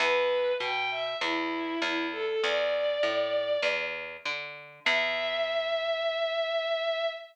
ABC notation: X:1
M:4/4
L:1/16
Q:1/4=99
K:Em
V:1 name="Violin"
B4 g2 e2 E4 E2 A A | d10 z6 | e16 |]
V:2 name="Electric Bass (finger)" clef=bass
E,,4 B,,4 E,,4 E,,4 | E,,4 A,,4 E,,4 D,4 | E,,16 |]